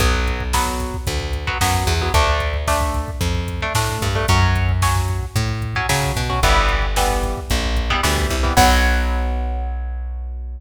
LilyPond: <<
  \new Staff \with { instrumentName = "Overdriven Guitar" } { \time 4/4 \key b \minor \tempo 4 = 112 <fis b>4 <fis b>4.~ <fis b>16 <fis b>16 <fis b>8. <fis b>16 | <a d'>4 <a d'>4.~ <a d'>16 <a d'>16 <a d'>8. <a d'>16 | <fis cis'>4 <fis cis'>4.~ <fis cis'>16 <fis cis'>16 <fis cis'>8. <fis cis'>16 | <e g b>4 <e g b>4.~ <e g b>16 <e g b>16 <e g b>8. <e g b>16 |
<fis b>1 | }
  \new Staff \with { instrumentName = "Electric Bass (finger)" } { \clef bass \time 4/4 \key b \minor b,,2 d,4 fis,8 e,8 | d,2 f,4 a,8 g,8 | fis,2 a,4 cis8 b,8 | g,,2 ais,,4 d,8 c,8 |
b,,1 | }
  \new DrumStaff \with { instrumentName = "Drums" } \drummode { \time 4/4 <hh bd>16 bd16 <hh bd>16 bd16 <bd sn>16 bd16 <hh bd>16 bd16 <hh bd>16 bd16 <hh bd>16 bd16 <bd sn>16 bd16 <hh bd>16 bd16 | <hh bd>16 bd16 <hh bd>16 bd16 <bd sn>16 bd16 <hh bd>16 bd16 <hh bd>16 bd16 <hh bd>16 bd16 <bd sn>16 bd16 <hh bd>16 bd16 | <hh bd>16 bd16 <hh bd>16 bd16 <bd sn>16 bd16 <hh bd>16 bd16 <hh bd>16 bd16 <hh bd>16 bd16 <bd sn>16 bd16 <hh bd>16 bd16 | <hh bd>16 bd16 <hh bd>16 bd16 <bd sn>16 bd16 <hh bd>16 bd16 <hh bd>16 bd16 <hh bd>16 bd16 <bd sn>16 bd16 <hh bd>16 bd16 |
<cymc bd>4 r4 r4 r4 | }
>>